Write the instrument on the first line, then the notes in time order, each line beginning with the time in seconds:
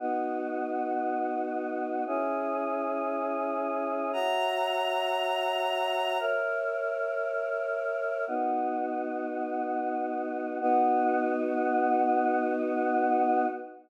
choir aahs
0.00 B3 D#4 F#4
2.07 C#4 E4 G#4
4.13 F#4 C#5 E5 A#5
6.20 A#4 C#5 E5
8.28 B3 D#4 F#4
10.61 B3 D#4 F#4